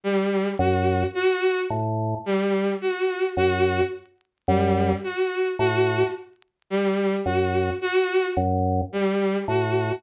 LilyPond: <<
  \new Staff \with { instrumentName = "Drawbar Organ" } { \clef bass \time 3/4 \tempo 4 = 54 r8 ges,8 r8 a,8 r4 | ges,8 r8 ges,8 r8 a,8 r8 | r8 ges,8 r8 ges,8 r8 a,8 | }
  \new Staff \with { instrumentName = "Violin" } { \time 3/4 g8 ges'8 ges'8 r8 g8 ges'8 | ges'8 r8 g8 ges'8 ges'8 r8 | g8 ges'8 ges'8 r8 g8 ges'8 | }
>>